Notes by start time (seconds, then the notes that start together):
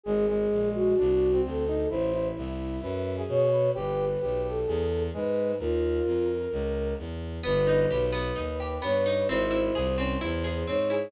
0.03 G#1 G#3 G#4
0.29 G#3
0.51 A#1
0.73 F#4
0.98 C2 D4
1.32 C4
1.44 D2 A4
1.67 D#4
1.89 A1 E4 C5
2.13 E4
2.35 C2 E5
2.82 F#2 B4
3.17 G#4
3.27 B2 C#5
3.52 B4
3.75 G1 G4 B4
4.21 B1 G4
4.43 A4
4.67 E2 G#4
5.13 G#2 G#3 B4
5.59 D#2 F4 A#4
6.05 F2
6.52 C#2
6.98 E2
7.43 G1 B3 B4
7.67 D#4
7.90 B1 G4 B4
8.12 B3
8.36 D#2 D#4
8.60 G4
8.82 G2 B3 B4 C#5
9.06 D#4
9.28 G#1 C4 E4 C5
9.51 E4
9.75 C2 G#4
9.98 C4 C#4
10.21 E2 E4 C5
10.44 G#4
10.67 G#2 C4 C#5
10.90 E4 G#4